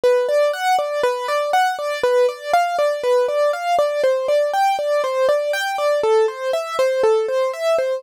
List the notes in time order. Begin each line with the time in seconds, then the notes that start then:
0.04 B4
0.29 D5
0.54 F#5
0.79 D5
1.03 B4
1.28 D5
1.53 F#5
1.79 D5
2.04 B4
2.29 D5
2.54 F5
2.79 D5
3.04 B4
3.28 D5
3.53 F5
3.79 D5
4.04 C5
4.28 D5
4.54 G5
4.79 D5
5.04 C5
5.29 D5
5.53 G5
5.78 D5
6.03 A4
6.28 C5
6.53 E5
6.79 C5
7.03 A4
7.28 C5
7.54 E5
7.78 C5